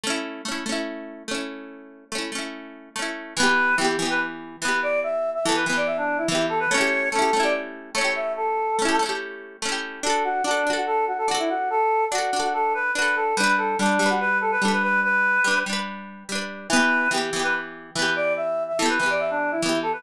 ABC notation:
X:1
M:4/4
L:1/16
Q:1/4=144
K:D
V:1 name="Choir Aahs"
z16 | z16 | B4 G3 B z4 B2 d2 | e3 e A B B d e D2 E E2 A B |
c4 A3 d z4 c2 e2 | A8 z8 | A2 F2 D3 F A2 F A F E F2 | A4 F3 F A2 B2 B2 A2 |
B2 A2 D3 F B2 A B A B B2 | B6 z10 | B4 G3 B z4 B2 d2 | e3 e A B B d e D2 E E2 A B |]
V:2 name="Orchestral Harp"
[A,CE]4 [A,CE]2 [A,CE]6 [A,CE]4- | [A,CE]4 [A,CE]2 [A,CE]6 [A,CE]4 | [E,B,G]4 [E,B,G]2 [E,B,G]6 [E,B,G]4- | [E,B,G]4 [E,B,G]2 [E,B,G]6 [E,B,G]4 |
[A,CEG]4 [A,CEG]2 [A,CEG]6 [A,CEG]4- | [A,CEG]4 [A,CEG]2 [A,CEG]6 [A,CEG]4 | [DFA]4 [DFA]2 [DFA]6 [DFA]4- | [DFA]4 [DFA]2 [DFA]6 [DFA]4 |
[G,DB]4 [G,DB]2 [G,DB]6 [G,DB]4- | [G,DB]4 [G,DB]2 [G,DB]6 [G,DB]4 | [E,B,G]4 [E,B,G]2 [E,B,G]6 [E,B,G]4- | [E,B,G]4 [E,B,G]2 [E,B,G]6 [E,B,G]4 |]